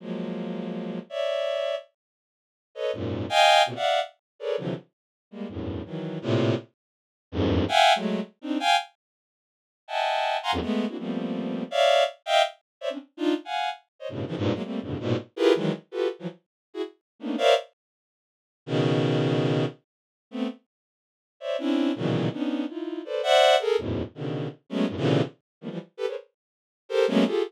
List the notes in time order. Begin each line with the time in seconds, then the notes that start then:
0.00 F3 F#3 G#3 A#3
1.10 C#5 D5 E5
2.75 A4 B4 C#5 D#5
2.93 F#2 G#2 A#2
3.29 D#5 F5 G5 G#5
3.66 A#2 B2 C3
3.75 D5 E5 F5 F#5
4.39 G#4 A4 A#4 B4 C#5 D5
4.57 C3 D3 E3 F3 F#3
5.31 G3 G#3 A#3
5.49 E2 F#2 G2 A2
5.85 D#3 E3 F#3
6.22 A2 A#2 C3
7.32 E2 F2 F#2 G2 G#2
7.68 E5 F5 F#5 G5 G#5
7.95 F#3 G#3 A3
8.41 C4 D4 D#4
8.60 F5 G5 G#5
9.88 D#5 E5 F#5 G5 G#5 A5
10.43 F5 F#5 G#5 A#5 C6
10.52 E2 F2 F#2
10.61 G#3 A3 B3
10.88 A#3 C4 D4 E4 F#4
10.98 F3 G3 A3 A#3 B3 C4
11.71 C#5 D5 E5 F5
12.26 D#5 E5 F5 G5
12.81 C5 C#5 D5 E5
12.90 C4 C#4 D4
13.17 D4 D#4 F4
13.45 F5 F#5 G#5
13.99 C5 C#5 D#5
14.09 G2 A2 B2 C#3
14.27 C#3 D#3 E3 F3
14.36 G2 G#2 A#2
14.54 F#3 G#3 A#3
14.63 G3 A3 A#3 C4
14.81 F2 G2 A2 B2 C#3 D3
15.00 G#2 A#2 B2
15.36 E4 F4 G4 G#4 A#4 B4
15.55 D#3 E3 F#3 G#3
15.91 F4 F#4 G4 A4 B4
16.19 E3 F3 F#3
16.74 E4 F#4 G#4
17.20 A3 A#3 B3 C#4 D4 D#4
17.38 A#4 C5 C#5 D5 E5 F5
18.66 B2 C#3 D#3
20.31 A3 B3 C4
21.40 C5 C#5 D5 E5
21.59 C4 C#4 D4 E4
21.96 A#2 B2 C#3 D#3 E3 F#3
22.32 B3 C#4 D4 D#4
22.68 D#4 E4 F4
23.05 A4 B4 C5 D5
23.23 C5 D5 E5 F#5
23.60 G#4 A4 A#4
23.78 E2 F#2 G#2 A2 B2
24.15 B2 C#3 D3 D#3
24.69 F#3 G#3 A3 B3 C#4
24.88 F#2 G2 A2
24.97 A#2 C3 C#3 D3 E3
25.61 D#3 F3 G3 A3 A#3 B3
25.70 E3 F3 G3
25.97 G4 A4 B4
26.07 G#4 A#4 B4 C5 C#5
26.89 G4 A4 A#4 C5
27.08 F#3 G#3 A3 A#3 B3 C#4
27.26 F4 G4 G#4 A4